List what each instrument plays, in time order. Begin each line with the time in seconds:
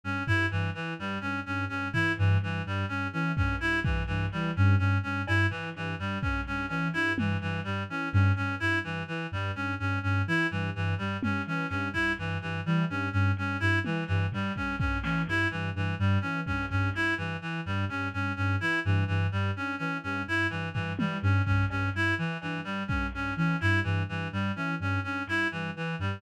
0.04 ocarina G2, clarinet C#4
0.27 ocarina G2, clarinet E4, floor tom
0.51 ocarina G2, clarinet E3
0.75 clarinet E3, ocarina E3
0.99 ocarina G2, clarinet G3
1.21 ocarina G2, clarinet C#4
1.46 ocarina G2, clarinet C#4
1.69 ocarina G2, clarinet C#4
1.93 ocarina E3, clarinet E4, floor tom
2.18 ocarina G2, clarinet E3, floor tom
2.41 ocarina G2, clarinet E3
2.65 ocarina G2, clarinet G3
2.88 ocarina G2, clarinet C#4
3.13 ocarina E3, clarinet C#4
3.37 ocarina G2, clarinet C#4, kick
3.60 ocarina G2, clarinet E4
3.84 ocarina G2, clarinet E3, kick
4.07 ocarina G2, clarinet E3
4.32 ocarina E3, clarinet G3
4.56 ocarina G2, clarinet C#4
4.79 ocarina G2, clarinet C#4
5.03 ocarina G2, clarinet C#4
5.27 ocarina G2, clarinet E4, cowbell
5.50 clarinet E3, ocarina E3, floor tom
5.75 ocarina G2, clarinet E3
5.99 ocarina G2, clarinet G3
6.22 ocarina G2, clarinet C#4, kick
6.46 ocarina G2, clarinet C#4, floor tom
6.69 ocarina E3, clarinet C#4, cowbell
6.93 ocarina G2, clarinet E4, closed hi-hat
7.17 ocarina G2, clarinet E3, high tom
7.41 ocarina G2, clarinet E3
7.64 ocarina G2, clarinet G3
7.89 ocarina E3, clarinet C#4
8.13 ocarina G2, clarinet C#4, floor tom
8.36 ocarina G2, clarinet C#4
8.60 ocarina G2, clarinet E4
8.84 ocarina G2, clarinet E3
9.08 clarinet E3, ocarina E3
9.32 ocarina G2, clarinet G3
9.55 ocarina G2, clarinet C#4
9.79 ocarina G2, clarinet C#4
10.03 ocarina G2, clarinet C#4
10.27 ocarina E3, clarinet E4
10.51 ocarina G2, clarinet E3
10.75 ocarina G2, clarinet E3
10.98 ocarina G2, clarinet G3
11.23 ocarina G2, clarinet C#4, high tom
11.46 ocarina E3, clarinet C#4
11.69 ocarina G2, clarinet C#4, clap
11.93 ocarina G2, clarinet E4, kick
12.18 ocarina G2, clarinet E3
12.42 ocarina G2, clarinet E3
12.65 ocarina E3, clarinet G3
12.89 ocarina G2, clarinet C#4
13.12 ocarina G2, clarinet C#4
13.37 ocarina G2, clarinet C#4, closed hi-hat
13.60 ocarina G2, clarinet E4
13.84 clarinet E3, ocarina E3, high tom
14.07 ocarina G2, clarinet E3
14.32 ocarina G2, clarinet G3, floor tom
14.55 ocarina G2, clarinet C#4, kick
14.79 ocarina G2, clarinet C#4, kick
15.03 ocarina E3, clarinet C#4, snare
15.27 ocarina G2, clarinet E4, snare
15.51 ocarina G2, clarinet E3
15.75 ocarina G2, clarinet E3
15.99 ocarina G2, clarinet G3
16.21 ocarina E3, clarinet C#4
16.46 ocarina G2, clarinet C#4, kick
16.70 ocarina G2, clarinet C#4, kick
16.94 ocarina G2, clarinet E4, snare
17.18 ocarina G2, clarinet E3
17.41 clarinet E3, ocarina E3
17.66 ocarina G2, clarinet G3
17.89 ocarina G2, clarinet C#4, floor tom
18.13 ocarina G2, clarinet C#4
18.37 ocarina G2, clarinet C#4
18.61 ocarina E3, clarinet E4
18.85 ocarina G2, clarinet E3
19.08 ocarina G2, clarinet E3
19.32 ocarina G2, clarinet G3
19.56 ocarina G2, clarinet C#4
19.78 ocarina E3, clarinet C#4
20.03 ocarina G2, clarinet C#4
20.27 ocarina G2, clarinet E4
20.50 ocarina G2, clarinet E3, closed hi-hat
20.74 ocarina G2, clarinet E3, floor tom
20.99 ocarina E3, clarinet G3, high tom
21.22 ocarina G2, clarinet C#4
21.46 ocarina G2, clarinet C#4, kick
21.70 ocarina G2, clarinet C#4, cowbell
21.94 ocarina G2, clarinet E4
22.18 ocarina E3, clarinet E3
22.41 ocarina G2, clarinet E3, cowbell
22.64 ocarina G2, clarinet G3
22.88 ocarina G2, clarinet C#4, kick
23.13 ocarina G2, clarinet C#4
23.36 ocarina E3, clarinet C#4
23.61 ocarina G2, clarinet E4, clap
23.84 ocarina G2, clarinet E3
24.09 ocarina G2, clarinet E3
24.32 ocarina G2, clarinet G3
24.56 ocarina E3, clarinet C#4
24.79 ocarina G2, clarinet C#4
25.03 ocarina G2, clarinet C#4
25.27 ocarina G2, clarinet E4, clap
25.51 ocarina G2, clarinet E3
25.75 ocarina E3, clarinet E3
25.99 ocarina G2, clarinet G3